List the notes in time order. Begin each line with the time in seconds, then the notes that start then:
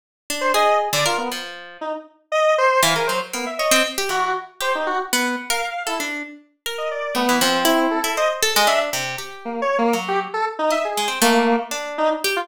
0.30 D4
0.41 C5
0.54 G#4 D#5
0.93 D3 D5
1.06 F4 A#4
1.18 B3
1.32 F3
1.81 D#4
2.32 D#5
2.58 C5
2.83 E3 F5
2.95 G#4 A#4
3.07 F#3 C5
3.33 A#3 B3
3.46 E5
3.59 C#5 D#5
3.71 C4
3.98 G4
4.09 E3 F#4
4.60 G4 C5
4.75 D#4
4.87 F#4
5.13 B3
5.50 A#4 F5
5.87 E4 A4
6.00 D4
6.66 A#4
6.78 D#5
6.91 D5
7.15 A3 B3
7.29 E3
7.41 F3 C4
7.65 E4
7.91 A4
8.04 E4
8.17 C5 D#5
8.42 A4
8.56 G#3 D#5
8.67 D4 E5
8.93 C3
9.18 G4
9.45 A#3
9.62 C#5
9.78 A#3
9.93 F#3
10.08 G4
10.34 A4
10.59 D#4
10.71 D#5 E5
10.85 G#4
10.97 G#3
11.08 C4
11.22 A3 A#3
11.71 D4
11.98 D#4
12.24 G4
12.36 F4